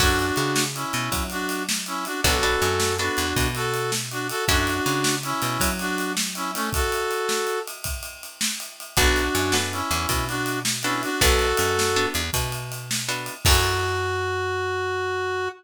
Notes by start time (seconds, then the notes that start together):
0.00 F#2 C#4 D4 E4 F#4 A4, kick, crash
0.19 ride
0.36 C#3, ride
0.56 snare
0.75 C#4 E4, ride
0.93 B2, ride
1.12 F#3, kick, ride
1.30 D4 F#4, ride
1.49 ride
1.69 snare
1.86 C#4 E4, ride
2.05 D4 F#4, ride
2.24 B1 B3 D4 F#4 A4, kick, ride
2.43 B3 D4 F#4 A4, ride
2.62 F#2, ride
2.80 snare
2.99 B3 D4 F#4 A4, ride
3.17 E2, ride
3.36 B2, kick, ride
3.55 F#4 A4, ride
3.74 ride
3.92 snare
4.11 D4 F#4, ride
4.29 F#4 A4, ride
4.48 F#2 C#4 D4 E4 F#4 A4, kick, ride
4.67 ride
4.86 C#3, ride
5.04 snare
5.23 C#4 E4, ride
5.42 B2, ride
5.60 F#3, kick, ride
5.79 D4 F#4, ride
5.98 ride
6.17 snare
6.35 C#4 E4, ride
6.54 A3 C#4, ride
6.73 F#4 A4, kick, ride
6.92 ride
7.11 ride
7.29 snare
7.47 ride
7.67 ride
7.84 kick, ride
8.03 ride
8.23 ride
8.41 snare
8.60 ride
8.80 ride
8.97 B1 B3 D4 F#4 A4, kick, ride
9.16 ride
9.35 F#2, ride
9.52 B3 D4 F#4 A4, snare
9.72 C#4 E4, ride
9.91 E2, ride
10.09 B2, kick, ride
10.28 D4 F#4, ride
10.46 ride
10.65 snare
10.83 B3 C#4 D4 E4 F#4 A4, ride
11.03 D4 F#4, ride
11.21 B1 B3 D4 F#4 A4, kick, ride
11.39 ride
11.57 F#2, ride
11.79 snare
11.96 B3 D4 F#4 A4, ride
12.14 E2, ride
12.33 B2, kick, ride
12.52 ride
12.72 ride
12.91 snare
13.09 B3 D4 F#4 A4, ride
13.26 ride
13.45 F#2 C#4 E4 F#4 A4, kick, crash